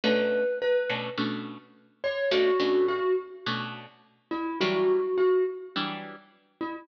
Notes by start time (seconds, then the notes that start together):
0.04 B2 A3 C#4 D4 B4
0.62 B4
0.90 B2 A3 C#4 D4
1.18 B2 A3 C#4 D4
2.04 C#5
2.31 B2 A3 C#4 D4 F#4
2.60 B2 A3 C#4 D4
2.88 F#4
3.46 B2 A3 C#4 D4
4.31 E4
4.60 E3 F#3 G3 D4 F#4
5.18 F#4
5.76 E3 F#3 G3 D4
6.61 E4